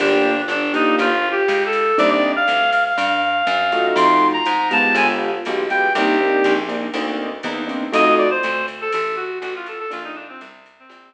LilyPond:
<<
  \new Staff \with { instrumentName = "Clarinet" } { \time 4/4 \key bes \major \tempo 4 = 121 d'4 d'8 ees'8 \tuplet 3/2 { f'4 g'4 a'4 } | d''16 d''8 f''8. f''16 f''2~ f''16 | c'''8. bes''8. a''8 aes''16 r4 r16 g''8 | g'4. r2 r8 |
ees''8 d''16 c''8. r16 a'16 a'8 ges'8 ges'16 f'16 a'16 a'16 | f'16 ees'16 d'16 c'16 r8. c'4~ c'16 r4 | }
  \new Staff \with { instrumentName = "Acoustic Grand Piano" } { \time 4/4 \key bes \major <bes d' f' g'>4. <bes d' f' g'>2~ <bes d' f' g'>8 | <bes c' d' ees'>2.~ <bes c' d' ees'>8 <a ees' f' ges'>8~ | <a ees' f' ges'>4. <aes b f' g'>4. <aes b f' g'>8 <aes b f' g'>8 | <bes c' d' ees'>8 <bes c' d' ees'>4 <bes c' d' ees'>8 <bes c' d' ees'>4 <bes c' d' ees'>8 <bes c' d' ees'>8 |
<a ees' f' ges'>1 | <a bes d' f'>2.~ <a bes d' f'>8 r8 | }
  \new Staff \with { instrumentName = "Electric Bass (finger)" } { \clef bass \time 4/4 \key bes \major g,,4 g,,4 g,,4 des,4 | c,4 d,4 g,4 ges,4 | f,4 aes,4 g,,4 b,,4 | c,4 bes,,4 d,4 e,4 |
f,4 d,4 a,,4 a,,4 | bes,,4 c,4 bes,,4 r4 | }
  \new DrumStaff \with { instrumentName = "Drums" } \drummode { \time 4/4 <cymc cymr>4 <hhp cymr>8 cymr8 <bd cymr>4 <hhp bd cymr>8 cymr8 | <bd cymr>4 <hhp cymr>8 cymr8 cymr4 <hhp cymr>8 cymr8 | cymr4 <hhp cymr>8 cymr8 cymr4 <hhp cymr>8 cymr8 | <bd cymr>4 <hhp bd cymr>8 cymr8 cymr4 <hhp bd cymr>8 cymr8 |
cymr4 <hhp cymr>8 cymr8 cymr4 <hhp cymr>8 cymr8 | cymr4 <hhp cymr>8 cymr8 cymr4 r4 | }
>>